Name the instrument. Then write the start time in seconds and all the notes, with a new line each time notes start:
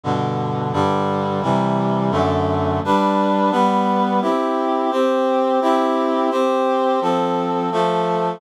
clarinet
0.03 G2 B2 D3
0.73 G2 D3 G3
1.42 C3 E3 G3
2.11 F#2 D3 A3
2.84 G3 D4 B4
3.51 G3 B3 B4
4.22 C4 E4 G4
4.91 C4 G4 C5
5.61 C4 E4 G4
6.31 C4 G4 C5
7.01 F3 C4 A4
7.72 F3 A3 A4